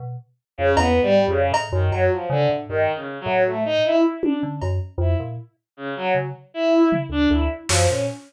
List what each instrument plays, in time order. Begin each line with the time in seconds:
0.00 electric piano 2 B2
0.58 electric piano 2 F2, violin C#3
0.76 electric piano 2 E2, violin B3, cowbell
1.03 electric piano 2 G#2, violin G3
1.28 electric piano 2 F2, violin C#3
1.52 electric piano 2 A2, cowbell
1.72 electric piano 2 F#2, violin D#3
1.92 electric piano 2 F#2, violin F#3, cowbell
2.11 violin F3
2.30 electric piano 2 C#3, violin D3
2.49 electric piano 2 A2
2.69 electric piano 2 G2, violin D#3
2.95 violin C#3
3.21 violin F#3
3.26 electric piano 2 A2
3.46 violin A3
3.65 violin D#4
3.84 violin E4
4.23 violin D4, high tom
4.43 electric piano 2 D3
4.62 electric piano 2 F#2, cowbell
4.98 electric piano 2 F2, violin E4
5.19 electric piano 2 A#2
5.77 violin C#3
5.96 violin F#3
6.15 electric piano 2 C#3
6.54 violin E4
6.92 floor tom
7.09 electric piano 2 D2, violin D4
7.30 electric piano 2 D2, violin E4
7.69 electric piano 2 F#2, violin F3, snare
7.88 electric piano 2 A#2, violin C#4